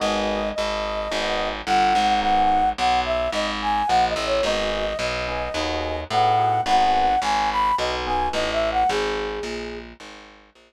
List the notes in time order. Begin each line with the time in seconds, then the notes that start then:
0.00 G#1 B3 D#4 F#4 G#4 D#5
0.55 G#1 D#5
1.11 G#1 B3 D#4 F#4 G#4
1.66 G1 F#5
1.95 G#1
2.21 B3 D#4 F#4 G#4 F#5
2.78 B1 F#5
3.05 E5
3.32 G#1 D#5
3.62 G#5
3.87 A#1 F#5
4.08 D#5
4.16 A1
4.26 C#5
4.43 G#1 B3 D#4 F#4 G#4 D#5
4.99 B1 D#5
5.27 B3 D#4 F#4 G#4
5.54 D#2 B3 D#4 F#4 G#4
6.10 A2 B3 D#4 F#4 G#4 F#5
6.39 B3 D#4 F#4 G#4
6.66 G#1 B3 D#4 F#4 G#4 F#5
7.22 G#1 G#5
7.51 B5
7.78 B1 D#5
8.06 B3 D#4 F#4 G#4 G#5
8.33 A1 D#5
8.53 E5
8.72 F#5
8.89 G#1 G#4
9.43 A#1
10.00 G#1
10.55 A#1